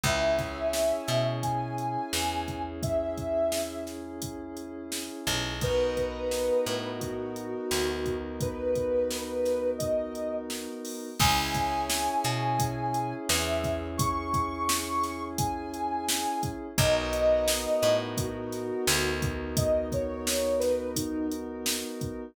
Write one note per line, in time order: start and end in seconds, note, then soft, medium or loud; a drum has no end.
0.03 0.93 C#2 medium
0.03 5.51 C#4 loud
0.03 5.51 E4 medium
0.03 5.51 G#4 medium
0.03 1.25 E5 loud
0.03 kick loud
0.03 closed hi-hat loud
0.39 kick loud
0.39 snare soft
0.39 closed hi-hat medium
0.73 snare loud
1.08 1.97 B2 medium
1.08 snare medium
1.08 closed hi-hat medium
1.42 2.62 G#5 medium
1.42 kick medium
1.42 closed hi-hat loud
1.78 closed hi-hat medium
2.13 5.09 E2 medium
2.13 snare loud
2.48 kick medium
2.48 closed hi-hat medium
2.83 3.84 E5 medium
2.83 kick loud
2.83 closed hi-hat loud
3.18 kick medium
3.18 closed hi-hat medium
3.52 snare loud
3.87 snare medium
3.87 closed hi-hat medium
4.22 kick medium
4.22 closed hi-hat loud
4.57 closed hi-hat medium
4.92 snare loud
5.27 6.51 B1 medium
5.27 kick medium
5.27 open hi-hat medium
5.61 11.08 B3 medium
5.61 11.08 D#4 medium
5.61 11.08 F#4 medium
5.61 11.08 A#4 medium
5.61 6.90 B4 loud
5.61 kick loud
5.61 closed hi-hat loud
5.97 kick medium
5.97 closed hi-hat medium
6.31 snare loud
6.66 7.55 A2 medium
6.66 snare medium
6.66 closed hi-hat medium
7.00 8.16 F#4 medium
7.00 kick medium
7.00 closed hi-hat loud
7.36 closed hi-hat medium
7.71 10.68 D2 medium
7.71 snare loud
8.06 kick medium
8.06 closed hi-hat medium
8.41 9.70 B4 loud
8.41 kick loud
8.41 closed hi-hat loud
8.75 kick medium
8.75 closed hi-hat medium
9.11 snare loud
9.45 snare medium
9.45 closed hi-hat medium
9.78 10.34 D#5 medium
9.78 kick loud
9.78 closed hi-hat loud
10.15 closed hi-hat medium
10.50 snare loud
10.85 open hi-hat medium
11.19 12.09 C#2 medium
11.19 16.67 C#4 loud
11.19 16.67 E4 medium
11.19 16.67 G#4 loud
11.19 11.86 G#5 loud
11.19 kick loud
11.19 crash loud
11.55 kick loud
11.55 closed hi-hat loud
11.88 13.14 G#5 medium
11.88 snare loud
12.24 13.14 B2 medium
12.24 snare medium
12.24 closed hi-hat medium
12.59 kick loud
12.59 closed hi-hat loud
12.94 closed hi-hat medium
13.29 16.26 E2 medium
13.29 13.87 E5 medium
13.29 snare loud
13.64 kick loud
13.64 snare soft
13.64 closed hi-hat medium
13.97 15.23 C#6 loud
13.97 kick loud
13.97 closed hi-hat loud
14.34 kick loud
14.34 closed hi-hat medium
14.69 snare loud
15.03 snare medium
15.03 closed hi-hat medium
15.38 16.50 G#5 medium
15.38 kick loud
15.38 closed hi-hat loud
15.74 closed hi-hat medium
16.09 snare loud
16.43 kick loud
16.43 closed hi-hat loud
16.78 17.67 B1 medium
16.78 22.25 B3 medium
16.78 22.25 D#4 medium
16.78 22.25 F#4 loud
16.78 22.25 A#4 medium
16.78 17.95 D#5 loud
16.78 kick loud
16.78 closed hi-hat loud
17.13 closed hi-hat loud
17.48 snare loud
17.82 18.72 A2 medium
17.82 snare medium
17.82 closed hi-hat loud
18.17 19.53 F#4 medium
18.17 kick loud
18.17 closed hi-hat loud
18.52 snare soft
18.52 closed hi-hat medium
18.87 21.84 D2 loud
18.87 snare loud
19.22 kick loud
19.22 closed hi-hat loud
19.57 19.87 D#5 medium
19.57 kick loud
19.57 closed hi-hat loud
19.92 20.60 C#5 medium
19.92 kick loud
19.92 closed hi-hat medium
20.27 snare loud
20.59 20.91 B4 loud
20.59 snare medium
20.59 closed hi-hat medium
20.95 21.27 D#4 medium
20.95 kick loud
20.95 closed hi-hat loud
21.32 closed hi-hat medium
21.66 snare loud
22.01 kick loud
22.01 closed hi-hat medium